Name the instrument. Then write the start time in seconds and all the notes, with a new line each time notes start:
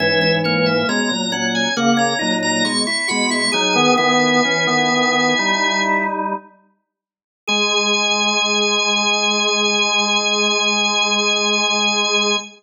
drawbar organ
0.00 G#2 E3 C#4 E5
0.21 C#4
0.44 A#3 C#5
0.66 E5
0.89 B2 G#3 C#4 A#5
1.11 A#2 F#3
1.32 A#2 F#3 C#4 F#5
1.55 G#5
1.76 C#3 A#3 F#5
1.97 C#4 A#5
2.19 A#2 F#3 D#4
2.43 A#5
2.65 B2 G#3 C#6
2.87 E4 C#6
3.08 B2 G#3 F#4 B5
3.30 E4 C#6
3.52 F#3 D#4 G#4 G#5
3.73 D#3 B3 G#4
3.97 D#3 B3 E4 G#5
4.45 E3 C#4
4.67 D#3 B3
4.92 D#3 B3
5.39 G3 D#4
7.47 G#3 G#4 G#5